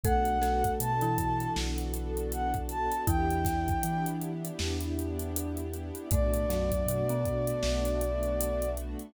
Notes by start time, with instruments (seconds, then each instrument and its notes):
0.03 synth bass 2 B1, marimba A3 A4, pad 2 (warm) B3 D4 F#4 A4, string ensemble 1 B3 D4 F#4 A4, ocarina F#5, kick, closed hi-hat
0.25 pad 2 (warm) B3 D4 F#4 A4, closed hi-hat
0.41 marimba A3 A4, snare, closed hi-hat
0.64 kick, closed hi-hat
0.80 synth bass 2 B2, pad 2 (warm) B3 D4 F#4 A4, ocarina A5, closed hi-hat
1.01 marimba E3 E4, closed hi-hat
1.18 kick, closed hi-hat
1.40 pad 2 (warm) B3 D4 F#4 A4, closed hi-hat
1.56 synth bass 2 B1, pad 2 (warm) B3 D4 F#4 A4, snare
1.78 pad 2 (warm) B3 D4 F#4 A4, closed hi-hat
1.94 pad 2 (warm) B3 D4 F#4 A4, closed hi-hat
2.17 closed hi-hat
2.32 ocarina F#5, closed hi-hat
2.54 kick, closed hi-hat
2.69 pad 2 (warm) B3 D4 F#4 A4, ocarina A5, closed hi-hat
2.91 pad 2 (warm) B3 D4 F#4 A4, closed hi-hat
3.07 synth bass 2 E2, marimba E3 E4, pad 2 (warm) B3 D4 E4 G4, string ensemble 1 B3 D4 E4 G4, ocarina G5, kick, closed hi-hat
3.29 pad 2 (warm) B3 D4 E4 G4, closed hi-hat
3.45 kick, snare, closed hi-hat
3.68 kick, closed hi-hat
3.83 synth bass 2 E3, pad 2 (warm) B3 D4 E4 G4, closed hi-hat
4.06 closed hi-hat
4.21 closed hi-hat
4.44 pad 2 (warm) B3 D4 E4 G4, closed hi-hat
4.59 synth bass 2 E2, pad 2 (warm) B3 D4 E4 G4, snare
4.81 pad 2 (warm) B3 D4 E4 G4, closed hi-hat
4.97 pad 2 (warm) B3 D4 E4 G4, closed hi-hat
5.19 closed hi-hat
5.36 closed hi-hat
5.57 closed hi-hat
5.73 pad 2 (warm) B3 D4 E4 G4, closed hi-hat
5.95 pad 2 (warm) B3 D4 E4 G4, closed hi-hat
6.11 synth bass 2 B1, marimba A2 A3, string ensemble 1 A3 B3 D4 F#4, pad 2 (warm) A3 B3 D4 F#4, ocarina D5, kick, closed hi-hat
6.33 pad 2 (warm) A3 B3 D4 F#4, closed hi-hat
6.49 marimba F#2 F#3, snare, closed hi-hat
6.72 kick, closed hi-hat
6.86 synth bass 2 B2, pad 2 (warm) A3 B3 D4 F#4, closed hi-hat
7.09 marimba B2 B3, closed hi-hat
7.25 kick, closed hi-hat
7.47 pad 2 (warm) A3 B3 D4 F#4, closed hi-hat
7.63 synth bass 2 B1, pad 2 (warm) A3 B3 D4 F#4, snare
7.85 pad 2 (warm) A3 B3 D4 F#4, closed hi-hat
8.01 pad 2 (warm) A3 B3 D4 F#4, closed hi-hat
8.23 closed hi-hat
8.41 closed hi-hat
8.62 closed hi-hat
8.77 pad 2 (warm) A3 B3 D4 F#4, closed hi-hat
8.99 pad 2 (warm) A3 B3 D4 F#4, closed hi-hat